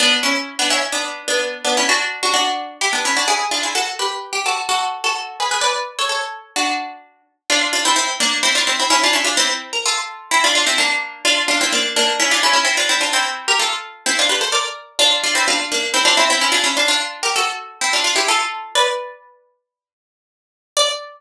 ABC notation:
X:1
M:4/4
L:1/16
Q:1/4=128
K:D
V:1 name="Harpsichord"
[B,D]2 [CE]3 [B,D] [CE] z [B,D]3 [B,D]3 [B,D] [CE] | [DF]3 [DF] [DF]4 [EG] [B,D] [CE] [DF] [E^G]2 [D=F] [EG] | [FA]2 [GB]3 G [FA] z [FA]3 [FA]3 [^GB] [GB] | [Bd]3 [Ac] [Ac]4 [DF]6 z2 |
[K:Dm] [DF]2 [DF] [CE] [CE]2 [B,D]2 [CE] [DF] [CE] [CE] [^CE] [DF] [CE] [DF] | [CE]3 B [FA]4 [CE] [DF] [DF] [CE] [B,D]4 | [DF]2 [DF] [CE] [B,D]2 [B,D]2 [^CE] [DF] [CE] [CE] [=CE] [DF] [CE] [DF] | [CE]3 [GB] [FA]4 [CE] [DF] [G=B] [Ac] [_Bd]4 |
[DF]2 [DF] [CE] [DF]2 [B,D]2 [CE] [DF] [CE] [CE] [^CE] [DF] [CE] [DF] | [DF]3 [GB] [^FA]4 [CE] [D=F] [DF] [EG] [FA]4 | [K:D] "^rit." [Bd]10 z6 | d16 |]